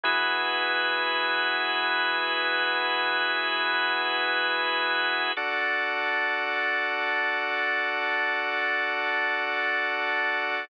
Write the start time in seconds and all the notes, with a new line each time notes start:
0.03 E3 B3 E4 F#4 G#4 B4
5.37 D4 F#4 A4 D5 F#5 A5